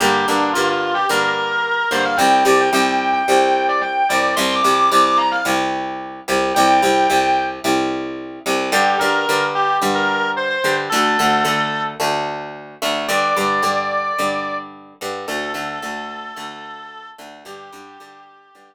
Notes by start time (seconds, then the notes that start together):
0.00 G2 D3 A#3 G4
0.27 G2 D3 A#3 D4
0.53 G2 D3 A#3 F4
0.69 F4
0.94 G4
1.09 G2 D3 A#3 A#4
1.91 G2 D3 A#3 C5
2.05 F5
2.17 C2 C3 G3 G5
2.45 C2 C3 G3 D5
2.61 G5
2.73 C2 C3 G3 G5
3.01 G5
3.13 G5
3.28 C2 C3 G3
3.68 D5
3.81 G5
4.09 C2 C3 G3 D5
4.36 C2 C3 G3 C6
4.54 D6
4.64 C2 C3 G3
4.74 D6
4.90 C2 C3 G3 D6
5.05 D6
5.17 A#5
5.31 F5
5.45 C2 C3 G3
6.28 C2 C3 G3
6.54 C2 C3 G3 G5
6.82 C2 C3 G3
7.10 C2 C3 G3
7.64 C2 C3 G3
8.46 C2 C3 G3
8.72 G2 D3 G3 G4
8.99 G2 D3 G3 A#4
9.29 G2 D3 G3
9.55 G4
9.82 G2 D3 G3
9.95 A#4
10.36 C5
10.49 C5
10.64 G2 D3 G3
10.89 D2 D3 A3 A4
11.19 D2 D3 A3
11.45 D2 D3 A3
12.00 D2 D3 A3
12.82 D2 D3 A3
13.08 G2 D3 G3 D5
13.36 G2 D3 G3
13.63 G2 D3 G3
14.19 G2 D3 G3
15.01 G2 D3 G3
15.28 D2 D3 A3 A4
15.54 D2 D3 A3
15.82 D2 D3 A3
16.36 D2 D3 A3
17.18 D2 D3 A3
17.45 G2 D3 G3 G4
17.73 G2 D3 G3
18.00 G2 D3 G3
18.55 G2 D3 G3